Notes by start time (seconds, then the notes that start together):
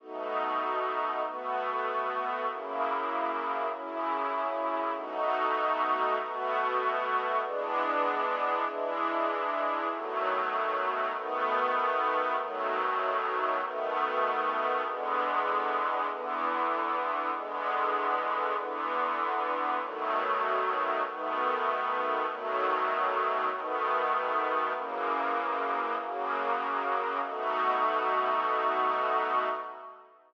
0.00 B2 A3 D#4 F#4
1.24 B2 A3 B3 F#4
2.47 F#2 C#3 A#3 E4
3.71 F#2 C#3 C#4 E4
4.95 B2 A3 D#4 F#4
6.18 B2 A3 B3 F#4
7.42 E3 G#3 B3 D4
8.66 E3 G#3 D4 E4
9.89 B2 D#3 F#3 A3
11.13 B2 D#3 A3 B3
12.38 B2 D#3 F#3 A3
13.61 B2 D#3 A3 B3
14.84 E2 D3 G#3 B3
16.08 E2 D3 E3 B3
17.32 E2 D3 G#3 B3
18.56 E2 D3 E3 B3
19.79 B2 D#3 F#3 A3
21.03 B2 D#3 A3 B3
22.26 B2 D#3 F#3 A3
23.50 B2 D#3 A3 B3
24.74 F#2 C#3 E3 A#3
25.98 F#2 C#3 F#3 A#3
27.22 B2 A3 D#4 F#4